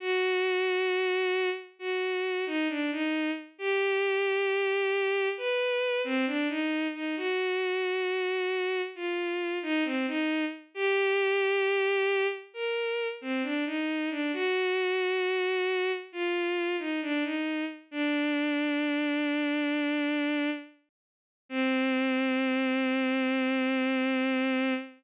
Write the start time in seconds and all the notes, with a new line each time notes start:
0.00 F#4
1.79 F#4
2.46 D#4
2.69 D4
2.92 D#4
3.58 G4
5.37 B4
6.04 C4
6.26 D4
6.49 D#4
6.94 D#4
7.17 F#4
8.95 F4
9.62 D#4
9.85 C4
10.07 D#4
10.74 G4
12.54 A#4
13.21 C4
13.43 D4
13.66 D#4
14.10 D4
14.33 F#4
16.12 F4
16.79 D#4
17.02 D4
17.24 D#4
17.91 D4
21.49 C4